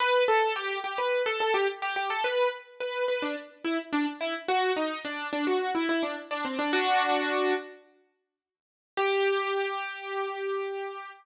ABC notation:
X:1
M:4/4
L:1/16
Q:1/4=107
K:G
V:1 name="Acoustic Grand Piano"
B2 A2 G2 G B2 A A G z G G A | B2 z2 B2 B D z2 E z D z E z | F2 _E2 D2 D F2 =E E D z D C D | [DF]6 z10 |
G16 |]